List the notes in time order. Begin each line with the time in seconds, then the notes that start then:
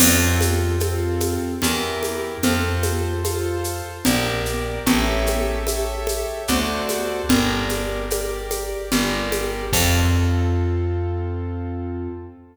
0.00 F2 C4 F4 A4, crash, low conga, shaker
0.41 high conga, shaker
0.80 C4 F4 A4, high conga, shaker
1.20 high conga, shaker
1.62 E2 E4 G4 A#4, low conga, shaker
2.03 high conga, shaker
2.43 F2 F4 A4 C5, low conga, shaker
2.83 high conga, shaker
3.24 F4 A4 C5, high conga, shaker
3.64 shaker
4.05 A#1 G4 A#4 D5, low conga, shaker
4.45 shaker
4.86 A1 G4 A4 C#5 E5, low conga, shaker
5.27 high conga, shaker
5.67 G4 A4 C#5 E5, high conga, shaker
6.07 high conga, shaker
6.48 D2 F#4 A4 C5 D5, low conga, shaker
6.89 high conga, shaker
7.29 G1 G4 A#4 D5, low conga, shaker
7.69 high conga, shaker
8.10 G4 A#4 D5, high conga, shaker
8.51 high conga, shaker
8.92 G1 G4 A#4 D5, low conga, shaker
9.32 high conga, shaker
9.73 F2 C4 F4 A4, kick, crash